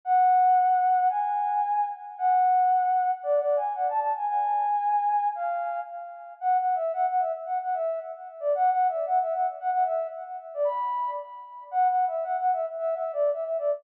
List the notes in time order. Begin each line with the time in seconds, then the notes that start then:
0.05 F#5
1.09 G#5
2.18 F#5
3.23 D5
3.39 D5
3.56 G#5
3.75 F#5
3.89 A5
4.00 A5
4.17 G#5
4.27 G#5
5.35 F5
6.40 F#5
6.58 F#5
6.75 E5
6.93 F#5
7.08 F#5
7.20 E5
7.46 F#5
7.62 F#5
7.74 E5
8.40 D5
8.55 F#5
8.71 F#5
8.88 E5
9.06 F#5
9.21 E5
9.34 F#5
9.60 F#5
9.71 F#5
9.85 E5
10.54 D5
10.64 B5
11.71 F#5
11.88 F#5
12.07 E5
12.24 F#5
12.38 F#5
12.53 E5
12.78 E5
12.95 E5
13.13 D5
13.32 E5
13.45 E5
13.58 D5